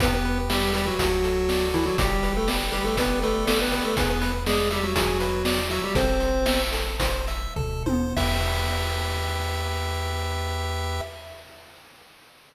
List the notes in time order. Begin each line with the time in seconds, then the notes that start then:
0.00 E2 B3 G4 B4, kick, closed hi-hat
0.14 B3 B4
0.25 B4
0.50 G3 G4 E5, snare, closed hi-hat
0.73 G3 G4 B4, closed hi-hat
0.87 F#3 F#4
0.99 D2 F#4, kick, closed hi-hat
1.24 A4, closed hi-hat
1.49 D5, snare
1.74 E3 E4 A4, closed hi-hat
1.86 F#3 F#4
1.98 G1 G3 G4, kick, closed hi-hat
2.23 B4, closed hi-hat
2.37 A3 A4
2.48 D5, snare
2.72 G3 G4 B4, closed hi-hat
2.84 A3 A4
2.97 B3 G4 B4, kick, closed hi-hat
3.22 A3 A4 B4, closed hi-hat
3.47 A3 A4 D5, snare
3.61 B3 B4
3.72 B3 B4, closed hi-hat
3.84 A3 A4
3.97 E2 B3 G#4 B4, kick, closed hi-hat
4.10 B3 B4
4.21 B4, closed hi-hat
4.46 G#3 G#4 D5, snare
4.70 G3 G4 E5, closed hi-hat
4.83 F#3 F#4
4.95 G#4, kick, closed hi-hat
5.20 B4, closed hi-hat
5.45 D5, snare
5.70 F#3 F#4 E5, closed hi-hat
5.84 G3 G4
5.95 A1 C4 A4 C5, kick, closed hi-hat
6.20 C5, closed hi-hat
6.46 E5, snare
6.72 A4, closed hi-hat
7.00 C5, kick, closed hi-hat
7.27 E5, closed hi-hat
7.56 D2 A4, kick, floor tom
7.86 D#2 C5, high tom
8.16 E2 G4 B4 E5, kick, crash